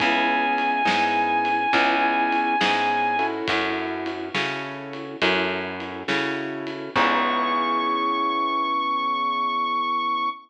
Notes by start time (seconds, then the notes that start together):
0.00 C#2 B3 C#4 E4 G#4 G#5, kick, ride
0.58 ride
0.85 G#2 B3 C#4 E4 G#4, snare
1.45 ride
1.73 C#2 B3 C#4 E4 G#4, kick, ride
2.32 ride
2.61 G#2 B3 C#4 E4 G#4, snare
3.19 C#4 E4 F#4 A4, ride
3.48 F#2, kick, ride
4.06 ride
4.34 C#3 C#4 E4 F#4 A4, snare
4.93 ride
5.22 F#2 C#4 E4 F#4 A4, kick, ride
5.80 ride
6.08 C#3 C#4 E4 F#4 A4, snare
6.67 ride
6.95 C#2 B3 C#4 E4 G#4 C#6, kick, crash